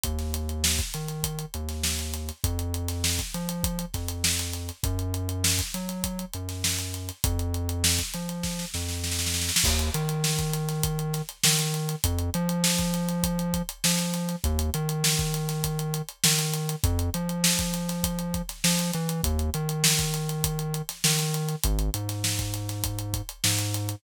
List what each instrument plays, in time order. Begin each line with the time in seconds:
0.04 synth bass 1 D#2, kick, closed hi-hat
0.19 snare, closed hi-hat
0.34 closed hi-hat
0.49 closed hi-hat
0.64 snare
0.79 kick, closed hi-hat
0.94 synth bass 1 D#3, closed hi-hat
1.08 closed hi-hat
1.23 kick, closed hi-hat
1.39 closed hi-hat
1.54 synth bass 1 D#2, closed hi-hat
1.69 snare, closed hi-hat
1.83 snare
1.99 closed hi-hat
2.14 closed hi-hat
2.29 closed hi-hat
2.44 synth bass 1 F2, kick, closed hi-hat
2.59 closed hi-hat
2.74 closed hi-hat
2.88 snare, closed hi-hat
3.04 snare
3.19 kick, snare, closed hi-hat
3.34 synth bass 1 F3, closed hi-hat
3.49 closed hi-hat
3.64 kick, closed hi-hat
3.79 closed hi-hat
3.94 synth bass 1 F2, kick, snare, closed hi-hat
4.08 closed hi-hat
4.24 snare
4.39 snare, closed hi-hat
4.53 closed hi-hat
4.69 closed hi-hat
4.83 synth bass 1 F#2, kick, closed hi-hat
4.99 closed hi-hat
5.14 closed hi-hat
5.29 closed hi-hat
5.44 snare
5.59 kick, closed hi-hat
5.74 synth bass 1 F#3, closed hi-hat
5.89 closed hi-hat
6.04 kick, closed hi-hat
6.19 closed hi-hat
6.33 synth bass 1 F#2, closed hi-hat
6.49 snare, closed hi-hat
6.64 snare
6.79 closed hi-hat
6.94 closed hi-hat
7.09 closed hi-hat
7.24 synth bass 1 F2, kick, closed hi-hat
7.39 closed hi-hat
7.54 closed hi-hat
7.69 closed hi-hat
7.84 snare
7.99 kick, closed hi-hat
8.14 synth bass 1 F3, closed hi-hat
8.29 closed hi-hat
8.43 kick, snare
8.59 snare
8.74 synth bass 1 F2, snare
8.88 snare
9.04 snare
9.12 snare
9.19 snare
9.27 snare
9.34 snare
9.42 snare
9.49 snare
9.56 snare
9.64 synth bass 1 D#2, kick, crash
9.79 closed hi-hat
9.94 synth bass 1 D#3, closed hi-hat
10.09 closed hi-hat
10.24 snare
10.39 kick, closed hi-hat
10.54 closed hi-hat
10.69 snare, closed hi-hat
10.83 kick, closed hi-hat
10.99 closed hi-hat
11.13 snare, closed hi-hat
11.29 closed hi-hat
11.44 synth bass 1 D#3, snare
11.59 snare, closed hi-hat
11.74 closed hi-hat
11.89 closed hi-hat
12.04 synth bass 1 F2, kick, closed hi-hat
12.19 closed hi-hat
12.34 synth bass 1 F3, closed hi-hat
12.49 closed hi-hat
12.64 snare
12.79 kick, closed hi-hat
12.94 closed hi-hat
13.09 closed hi-hat
13.23 kick, closed hi-hat
13.39 closed hi-hat
13.54 kick, closed hi-hat
13.69 closed hi-hat
13.84 synth bass 1 F3, snare
13.99 closed hi-hat
14.14 snare, closed hi-hat
14.29 closed hi-hat
14.44 synth bass 1 D#2, kick, closed hi-hat
14.59 closed hi-hat
14.74 synth bass 1 D#3, closed hi-hat
14.89 closed hi-hat
15.04 snare
15.19 kick, closed hi-hat
15.34 closed hi-hat
15.49 snare, closed hi-hat
15.64 kick, closed hi-hat
15.79 closed hi-hat
15.94 closed hi-hat
16.09 closed hi-hat
16.24 synth bass 1 D#3, snare
16.39 closed hi-hat
16.54 closed hi-hat
16.69 closed hi-hat
16.84 synth bass 1 F2, kick, closed hi-hat
16.99 closed hi-hat
17.14 synth bass 1 F3, closed hi-hat
17.29 closed hi-hat
17.44 snare
17.59 kick, closed hi-hat
17.74 closed hi-hat
17.89 snare, closed hi-hat
18.04 kick, closed hi-hat
18.19 closed hi-hat
18.34 kick, closed hi-hat
18.49 snare, closed hi-hat
18.64 synth bass 1 F3, snare
18.79 closed hi-hat
18.93 synth bass 1 E3, closed hi-hat
19.09 closed hi-hat
19.23 synth bass 1 D#2, kick, closed hi-hat
19.39 closed hi-hat
19.54 synth bass 1 D#3, closed hi-hat
19.69 closed hi-hat
19.84 snare
19.99 kick, closed hi-hat
20.14 closed hi-hat
20.29 closed hi-hat
20.44 kick, closed hi-hat
20.59 closed hi-hat
20.74 closed hi-hat
20.89 snare, closed hi-hat
21.04 synth bass 1 D#3, snare
21.19 snare, closed hi-hat
21.34 closed hi-hat
21.49 closed hi-hat
21.64 synth bass 1 G#1, kick, closed hi-hat
21.79 closed hi-hat
21.94 synth bass 1 G#2, closed hi-hat
22.09 snare, closed hi-hat
22.24 snare
22.38 kick, snare, closed hi-hat
22.54 closed hi-hat
22.69 snare, closed hi-hat
22.84 kick, closed hi-hat
22.99 closed hi-hat
23.14 kick, closed hi-hat
23.29 closed hi-hat
23.44 synth bass 1 G#2, snare
23.59 closed hi-hat
23.74 closed hi-hat
23.89 closed hi-hat